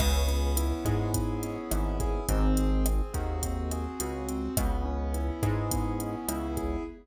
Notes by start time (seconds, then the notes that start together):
0.00 C#2 B3, kick, cross-stick, crash
0.28 C#4, closed hi-hat
0.56 E4, closed hi-hat
0.85 G#2 G#4, kick, cross-stick, closed hi-hat
1.14 B3, kick, closed hi-hat
1.43 C#4, closed hi-hat
1.71 G#1 E4, cross-stick, closed hi-hat
2.00 G#4, kick, closed hi-hat
2.29 G#1 C4, kick, closed hi-hat
2.57 G#4, closed hi-hat
2.86 C4, cross-stick, closed hi-hat
3.13 D#2 F#4, kick, closed hi-hat
3.43 C4, kick, closed hi-hat
3.71 G#4, cross-stick, closed hi-hat
4.00 C#2 F#4, closed hi-hat
4.29 C4, closed hi-hat
4.57 C#2 B3, kick, cross-stick, closed hi-hat
4.85 C#4
5.14 E4, closed hi-hat
5.43 G#2 G#4, kick, cross-stick, closed hi-hat
5.71 B3, kick, closed hi-hat
6.00 C#4, closed hi-hat
6.28 C#2 E4, cross-stick, closed hi-hat
6.57 G#4, kick, closed hi-hat